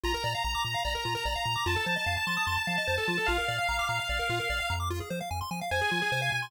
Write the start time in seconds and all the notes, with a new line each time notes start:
0.03 A#1 F4 A#5
0.14 A#4
0.24 A#2 D5
0.34 F5
0.44 A#1 A#5
0.55 D6
0.64 A#2 A#5
0.74 F5
0.85 A#1 D5
0.95 A#4
1.05 A#2 F4
1.15 A#4
1.25 A#1 D5
1.35 F5
1.45 A#2 A#5
1.56 D6
1.66 F2 F4 A5
1.76 A4
1.86 F3 C5
1.96 D#5
2.06 F2 F5
2.17 A5
2.27 F3 C6
2.37 D#6
2.47 F2 C6
2.57 A5
2.67 F3 F5
2.78 D#5
2.87 F2 C5
2.98 A4
3.08 F3 F4
3.18 A4
3.26 A#1 F4 F5
3.38 A#4
3.48 A#2 D5
3.59 F5
3.69 A#1 A#5
3.79 D6
3.89 A#2 A#5
3.99 F5
4.09 A#1 D5
4.19 A#4
4.29 A#2 F4
4.40 A#4
4.50 A#1 D5
4.60 F5
4.70 F2 A#5
4.80 D6
4.90 F4
5.00 G#4
5.10 F3 C5
5.21 F5
5.31 F2 G#5
5.41 C6
5.51 F3 G#5
5.61 F5
5.71 F2 C5 G#5
5.81 G#4
5.91 F3 F4
6.02 G#4
6.12 C3 C5
6.22 F5
6.32 B2 G#5
6.42 C6